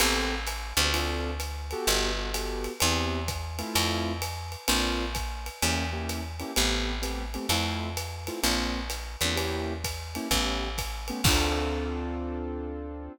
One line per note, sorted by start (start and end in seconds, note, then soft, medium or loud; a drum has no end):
0.00 0.73 A1 loud
0.00 0.35 B3 medium
0.00 0.35 C4 medium
0.00 0.35 G4 medium
0.00 0.35 A4 medium
0.00 crash medium
0.00 ride medium
0.47 hi-hat pedal medium
0.47 ride medium
0.77 1.74 D2 loud
0.77 0.89 B3 medium
0.77 0.89 C4 medium
0.77 0.89 G4 medium
0.77 0.89 A4 medium
0.77 ride medium
0.93 1.30 C4 medium
0.93 1.30 D4 medium
0.93 1.30 F4 medium
0.93 1.30 A4 medium
0.93 ride medium
1.40 hi-hat pedal medium
1.40 ride medium
1.71 2.10 B3 medium
1.71 2.10 F#4 medium
1.71 2.10 G4 medium
1.71 2.10 A4 medium
1.71 ride medium
1.87 2.68 G1 loud
1.87 ride medium
2.17 2.29 B3 medium
2.17 2.29 F#4 medium
2.17 2.29 G4 medium
2.17 2.29 A4 medium
2.34 2.71 B3 medium
2.34 2.71 F#4 medium
2.34 2.71 G4 medium
2.34 2.71 A4 medium
2.34 hi-hat pedal medium
2.34 ride medium
2.64 ride medium
2.80 3.62 E2 loud
2.80 3.20 B3 loud
2.80 3.20 C4 medium
2.80 3.20 E4 medium
2.80 3.20 G4 medium
2.80 ride medium
3.28 kick medium
3.28 hi-hat pedal medium
3.28 ride medium
3.59 4.12 A3 medium
3.59 4.12 C4 medium
3.59 4.12 E4 medium
3.59 4.12 F4 medium
3.59 ride medium
3.75 4.56 F2 loud
3.75 ride loud
4.22 hi-hat pedal medium
4.22 ride medium
4.52 ride medium
4.68 5.49 A#1 loud
4.68 5.05 A#3 medium
4.68 5.05 C4 medium
4.68 5.05 D4 medium
4.68 5.05 F4 loud
4.68 ride loud
5.15 kick medium
5.15 hi-hat pedal medium
5.15 ride medium
5.46 ride medium
5.62 6.43 E2 loud
5.62 5.84 A#3 medium
5.62 5.84 C#4 medium
5.62 5.84 E4 medium
5.62 5.84 G4 medium
5.62 ride medium
5.93 6.22 A#3 medium
5.93 6.22 C#4 medium
5.93 6.22 E4 medium
5.93 6.22 G4 medium
6.09 hi-hat pedal medium
6.09 ride medium
6.40 6.52 A#3 medium
6.40 6.52 C#4 medium
6.40 6.52 E4 medium
6.40 6.52 G4 medium
6.40 ride medium
6.56 7.38 A1 loud
6.56 6.94 A3 medium
6.56 6.94 B3 medium
6.56 6.94 C4 loud
6.56 6.94 G4 medium
6.56 ride medium
7.02 7.23 A3 medium
7.02 7.23 B3 medium
7.02 7.23 C4 medium
7.02 7.23 G4 medium
7.02 hi-hat pedal medium
7.02 ride medium
7.34 7.46 A3 medium
7.34 7.46 B3 medium
7.34 7.46 C4 medium
7.34 7.46 G4 medium
7.34 ride medium
7.49 8.30 F2 loud
7.49 7.89 A3 medium
7.49 7.89 C4 medium
7.49 7.89 E4 medium
7.49 7.89 F4 medium
7.49 ride medium
7.97 hi-hat pedal medium
7.97 ride medium
8.27 8.40 A3 medium
8.27 8.40 C4 medium
8.27 8.40 E4 medium
8.27 8.40 F4 medium
8.27 ride medium
8.43 9.16 A#1 loud
8.43 8.80 A#3 medium
8.43 8.80 C4 medium
8.43 8.80 D4 medium
8.43 8.80 F4 medium
8.43 ride medium
8.90 hi-hat pedal medium
8.90 ride medium
9.21 10.18 E2 loud
9.21 9.34 A#3 medium
9.21 9.34 C4 medium
9.21 9.34 D4 medium
9.21 9.34 F4 medium
9.21 ride medium
9.36 9.73 A#3 medium
9.36 9.73 C#4 medium
9.36 9.73 E4 medium
9.36 9.73 G4 medium
9.36 ride medium
9.84 kick medium
9.84 hi-hat pedal medium
9.84 ride medium
10.15 10.27 A#3 medium
10.15 10.27 C#4 medium
10.15 10.27 E4 medium
10.15 10.27 G4 medium
10.15 ride medium
10.31 11.12 A1 loud
10.31 10.68 A3 medium
10.31 10.68 B3 medium
10.31 10.68 C#4 medium
10.31 10.68 G4 medium
10.31 kick medium
10.31 ride medium
10.78 kick medium
10.78 hi-hat pedal medium
10.78 ride medium
11.08 11.21 A3 medium
11.08 11.21 B3 medium
11.08 11.21 C#4 medium
11.08 11.21 G4 medium
11.08 ride medium
11.24 13.09 D2 loud
11.24 13.12 C4 loud
11.24 13.12 D4 loud
11.24 13.12 F4 loud
11.24 13.12 A4 loud
11.24 kick loud
11.24 crash loud